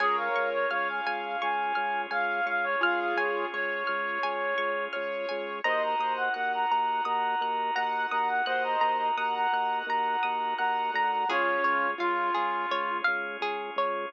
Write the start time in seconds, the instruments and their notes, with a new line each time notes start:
0.00 drawbar organ C#2 C#4 F4 G#4, clarinet G#4, acoustic grand piano A#4 C#5, pizzicato strings G#5
0.17 clarinet F5
0.36 drawbar organ C#2, pizzicato strings C#6
0.53 clarinet C#5
0.71 drawbar organ C#2, clarinet C#5, acoustic grand piano F5, pizzicato strings F6
0.89 clarinet G#5
1.06 drawbar organ C#2, pizzicato strings G#5
1.42 drawbar organ C#2, clarinet G#5, pizzicato strings C#6
1.75 drawbar organ C#2, pizzicato strings F6
2.11 drawbar organ C#2, acoustic grand piano F5, clarinet F5, pizzicato strings G#5
2.46 drawbar organ C#2, clarinet F5, pizzicato strings C#6
2.64 clarinet C#5
2.81 drawbar organ C#2, acoustic grand piano F4 G#4, clarinet F5, pizzicato strings F6
3.00 clarinet F5
3.16 drawbar organ C#2, clarinet C#5, pizzicato strings G#5
3.53 drawbar organ C#2, clarinet C#5, acoustic grand piano C#5, pizzicato strings C#6
3.87 drawbar organ C#2, pizzicato strings F6
4.23 drawbar organ C#2, pizzicato strings G#5
4.58 drawbar organ C#2, pizzicato strings C#6
4.93 drawbar organ C#2, acoustic grand piano C#5, pizzicato strings F6
5.29 drawbar organ C#2, pizzicato strings G#5
5.64 drawbar organ D#2 D#4 F#4 A#4, acoustic grand piano C5 D#5, clarinet D#5, pizzicato strings A#5
5.83 clarinet A#5
5.99 drawbar organ D#2, pizzicato strings D#6
6.17 clarinet F#5
6.34 drawbar organ D#2, acoustic grand piano F#5, clarinet F#5, pizzicato strings F#6
6.54 clarinet A#5
6.71 drawbar organ D#2, pizzicato strings A#5
7.05 drawbar organ D#2, clarinet A#5, pizzicato strings D#6
7.41 drawbar organ D#2, pizzicato strings F#6
7.76 drawbar organ D#2, acoustic grand piano F#5, pizzicato strings A#5, clarinet A#5
8.11 drawbar organ D#2, clarinet A#5, pizzicato strings D#6
8.28 clarinet F#5
8.46 drawbar organ D#2, acoustic grand piano C5 D#5, clarinet F#5, pizzicato strings F#6
8.64 clarinet A#5
8.81 drawbar organ D#2, pizzicato strings A#5
8.99 clarinet A#5
9.17 drawbar organ D#2, acoustic grand piano F#5, clarinet A#5, pizzicato strings D#6
9.35 clarinet A#5
9.53 drawbar organ D#2, pizzicato strings F#6
9.87 drawbar organ D#2, clarinet A#5, pizzicato strings A#5
10.23 drawbar organ D#2, pizzicato strings D#6
10.58 drawbar organ D#2, acoustic grand piano F#5, clarinet A#5, pizzicato strings F#6
10.94 drawbar organ D2, clarinet A#5, pizzicato strings A#5
11.12 clarinet A#5
11.28 drawbar organ C#2 C#4 F4 G#4, acoustic grand piano C#4 F4, pizzicato strings G#4, clarinet C#5
11.64 drawbar organ C#2, pizzicato strings C#5
11.98 drawbar organ C#2, acoustic grand piano F4, clarinet F4, pizzicato strings F5
12.35 drawbar organ C#2, pizzicato strings G#4
12.71 drawbar organ C#2, pizzicato strings C#5
13.04 drawbar organ C#2, pizzicato strings F5
13.41 drawbar organ C#2, pizzicato strings G#4
13.76 drawbar organ C#2, pizzicato strings C#5